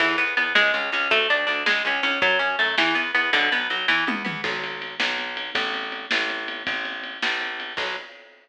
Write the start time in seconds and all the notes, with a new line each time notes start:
0.00 E2 E3, kick, crash
0.18 E2 B3, closed hi-hat
0.37 E2 B3, closed hi-hat
0.55 C#2 G#3, snare
0.74 C#2 C#4, closed hi-hat
0.92 C#2 C#4, closed hi-hat
1.11 D2 A3, kick, closed hi-hat
1.29 D2 D4, closed hi-hat
1.47 D2 D4, closed hi-hat
1.66 C#2 G#3, snare
1.85 C#2 C#4, closed hi-hat
2.03 C#2 C#4, closed hi-hat
2.22 F#2 F#3, kick, closed hi-hat
2.39 F#2 C#4, closed hi-hat
2.59 F#2 A3, closed hi-hat
2.78 E2 E3, snare
2.95 E2 B3, closed hi-hat
3.15 E2 B3, closed hi-hat
3.33 B1 D3, kick, closed hi-hat
3.52 B1 B3, closed hi-hat
3.70 B1 F#3, closed hi-hat
3.88 E2 E3, kick, snare
4.07 E2 B3, high tom
4.25 E2 B3, mid tom
4.44 B1, kick, crash
4.64 ride
4.82 ride
5.00 B1, snare
5.18 ride
5.37 ride
5.55 A1, kick, ride
5.74 ride
5.92 ride
6.11 A1, snare
6.30 ride
6.48 ride
6.67 A1, kick, ride
6.85 ride
7.04 ride
7.22 A#1, snare
7.41 ride
7.60 ride
7.77 B1, kick, crash